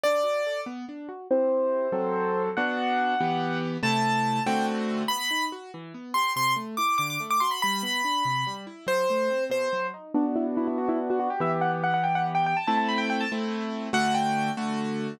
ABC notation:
X:1
M:6/8
L:1/16
Q:3/8=95
K:Em
V:1 name="Acoustic Grand Piano"
d6 z6 | [K:G] c12 | f12 | a6 g2 z4 |
[K:Em] b4 z6 c'2 | c'2 z2 d'2 d' d' z d' c' b | b10 z2 | c6 c4 z2 |
[K:G] D z E z E E F E z F F G | e z f z f f g f z g g a | a a b g g a z6 | f2 g4 z6 |]
V:2 name="Acoustic Grand Piano"
D2 F2 A2 B,2 D2 F2 | [K:G] [CEG]6 [F,CA]6 | [B,DF]6 [E,B,G]6 | [C,A,E]6 [D,A,CF]6 |
[K:Em] B,2 ^D2 F2 E,2 B,2 G2 | C,2 A,2 E2 D,2 A,2 F2 | G,2 B,2 D2 C,2 G,2 E2 | F,2 A,2 C2 B,,2 F,2 ^D2 |
[K:G] [B,DF]12 | [E,B,G]12 | [A,CE]6 [A,CE]6 | [D,A,F]6 [D,A,F]6 |]